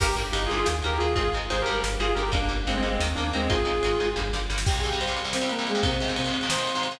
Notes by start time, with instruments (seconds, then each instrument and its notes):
0.00 synth bass 1 G1, overdriven guitar D3 G3 A#3, distortion guitar G4 A#4, kick, crash
0.16 synth bass 1 G1, overdriven guitar D3 G3 A#3, ride
0.32 synth bass 1 G1, overdriven guitar D3 G3 A#3, distortion guitar D#4 G4, ride
0.46 distortion guitar F4 G#4, ride
0.50 synth bass 1 G1, overdriven guitar D3 G3 A#3
0.56 distortion guitar F4 G#4
0.66 synth bass 1 D#2, overdriven guitar D#3 A#3, snare
0.82 synth bass 1 D#2, overdriven guitar D#3 A#3, distortion guitar G4 A#4, ride
0.98 synth bass 1 D#2, overdriven guitar D#3 A#3, distortion guitar F4 G#4, ride
1.15 synth bass 1 G#1, overdriven guitar D#3 G#3 C4, distortion guitar F4 G#4, kick, ride
1.33 synth bass 1 G#1, overdriven guitar D#3 G#3 C4, ride
1.49 synth bass 1 G#1, overdriven guitar D#3 G#3 C4, distortion guitar G#4 C5, ride
1.62 distortion guitar G4 A#4
1.66 synth bass 1 G#1, overdriven guitar D3 G3 A#3, ride
1.73 distortion guitar G4 A#4
1.83 synth bass 1 G1, snare
2.00 synth bass 1 G1, overdriven guitar D3 G3 A#3, distortion guitar F4 G#4, ride
2.15 synth bass 1 G1, overdriven guitar D3 G3 A#3, distortion guitar G4 A#4, ride
2.32 synth bass 1 G1, overdriven guitar D3 G3 A#3, distortion guitar A#3 D4, kick, ride
2.49 synth bass 1 G1, overdriven guitar D3 G3 A#3, ride
2.67 synth bass 1 G1, overdriven guitar D3 G3 A#3, distortion guitar G#3 C4, ride
2.77 distortion guitar G#3 C4
2.82 synth bass 1 G1, overdriven guitar D3 G3 A#3, ride
2.90 distortion guitar G#3 C4
2.99 synth bass 1 D#2, overdriven guitar D#3 A#3, snare
3.15 synth bass 1 D#2, overdriven guitar D#3 A#3, distortion guitar A#3 D4, ride
3.33 synth bass 1 D#2, overdriven guitar D#3 A#3, distortion guitar G#3 C4, ride
3.49 synth bass 1 G#1, overdriven guitar D#3 G#3 C4, distortion guitar F4 G#4, kick, ride
3.65 synth bass 1 G#1, overdriven guitar D#3 G#3 C4, ride
3.83 synth bass 1 G#1, overdriven guitar D#3 G#3 C4, ride
4.00 synth bass 1 G#1, overdriven guitar D#3 G#3 C4, ride
4.16 synth bass 1 G1, overdriven guitar D3 G3 A#3, kick, snare
4.33 synth bass 1 G1, overdriven guitar D3 G3 A#3, snare
4.50 synth bass 1 G1, overdriven guitar D3 G3 A#3, snare
4.58 snare
4.66 overdriven guitar C2 C3 G3, lead 2 (sawtooth) G4 G5, kick, crash
4.74 ride
4.78 lead 2 (sawtooth) G#4 G#5
4.83 overdriven guitar C2 C3 G3, ride
4.88 overdriven guitar C2 C3 G3, lead 2 (sawtooth) G4 G5, ride
5.00 lead 2 (sawtooth) C5 C6, ride
5.07 overdriven guitar C2 C3 G3, ride
5.17 ride
5.24 overdriven guitar C2 C3 G3, ride
5.33 lead 2 (sawtooth) C4 C5, snare
5.41 overdriven guitar C2 C3 G3, ride
5.49 lead 2 (sawtooth) A#3 A#4, ride
5.59 overdriven guitar C2 C3 G3, ride
5.67 lead 2 (sawtooth) G#3 G#4, ride
5.75 overdriven guitar C2 C3 G3, ride
5.83 overdriven guitar G#2 C3 D#3, lead 2 (sawtooth) C3 C4, kick, ride
5.91 ride
6.00 overdriven guitar G#2 C3 D#3, ride
6.08 overdriven guitar G#2 C3 D#3, ride
6.16 lead 2 (sawtooth) C4 C5, ride
6.24 overdriven guitar G#2 C3 D#3, ride
6.34 ride
6.41 overdriven guitar G#2 C3 D#3, ride
6.49 lead 2 (sawtooth) C5 C6, snare
6.57 overdriven guitar G#2 C3 D#3, ride
6.67 ride
6.75 overdriven guitar G#2 C3 D#3, ride
6.83 ride
6.91 overdriven guitar G#2 C3 D#3, ride